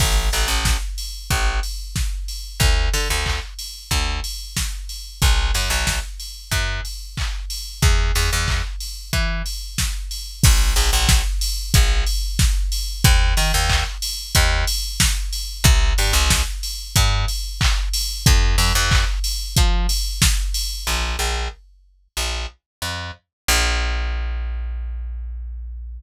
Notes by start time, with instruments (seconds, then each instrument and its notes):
0.00 electric bass (finger) A1, kick, crash
0.33 electric bass (finger) A1, open hi-hat
0.48 electric bass (finger) A1
0.65 kick, snare
0.98 open hi-hat
1.30 electric bass (finger) A1, kick, closed hi-hat
1.63 open hi-hat
1.96 kick, snare
2.28 open hi-hat
2.60 electric bass (finger) D2, kick, closed hi-hat
2.93 electric bass (finger) D3, open hi-hat
3.10 electric bass (finger) D2
3.26 kick, clap
3.59 open hi-hat
3.91 electric bass (finger) D2, kick, closed hi-hat
4.24 open hi-hat
4.57 kick, snare
4.89 open hi-hat
5.22 electric bass (finger) B1, kick, closed hi-hat
5.54 electric bass (finger) F#2, open hi-hat
5.70 electric bass (finger) B1
5.87 kick, snare
6.20 open hi-hat
6.51 electric bass (finger) F#2, kick, closed hi-hat
6.85 open hi-hat
7.17 kick, clap
7.50 open hi-hat
7.82 electric bass (finger) E2, kick, closed hi-hat
8.15 electric bass (finger) E2, open hi-hat
8.33 electric bass (finger) E2
8.48 kick, clap
8.80 open hi-hat
9.13 electric bass (finger) E3, kick, closed hi-hat
9.46 open hi-hat
9.78 kick, snare
10.11 open hi-hat
10.43 electric bass (finger) A#1, kick, crash
10.76 electric bass (finger) A#1, open hi-hat
10.93 electric bass (finger) A#1
11.09 kick, snare
11.41 open hi-hat
11.74 electric bass (finger) A#1, kick, closed hi-hat
12.07 open hi-hat
12.39 kick, snare
12.72 open hi-hat
13.04 electric bass (finger) D#2, kick, closed hi-hat
13.37 electric bass (finger) D#3, open hi-hat
13.54 electric bass (finger) D#2
13.70 kick, clap
14.02 open hi-hat
14.35 electric bass (finger) D#2, kick, closed hi-hat
14.67 open hi-hat
15.00 kick, snare
15.33 open hi-hat
15.64 electric bass (finger) C2, kick, closed hi-hat
15.98 electric bass (finger) G2, open hi-hat
16.13 electric bass (finger) C2
16.30 kick, snare
16.63 open hi-hat
16.96 electric bass (finger) G2, kick, closed hi-hat
17.28 open hi-hat
17.61 kick, clap
17.93 open hi-hat
18.26 electric bass (finger) F2, kick, closed hi-hat
18.58 electric bass (finger) F2, open hi-hat
18.75 electric bass (finger) F2
18.91 kick, clap
19.24 open hi-hat
19.57 electric bass (finger) F3, kick, closed hi-hat
19.89 open hi-hat
20.22 kick, snare
20.54 open hi-hat
20.87 electric bass (finger) A#1
21.19 electric bass (finger) A#1
22.17 electric bass (finger) A#1
22.82 electric bass (finger) F2
23.48 electric bass (finger) A#1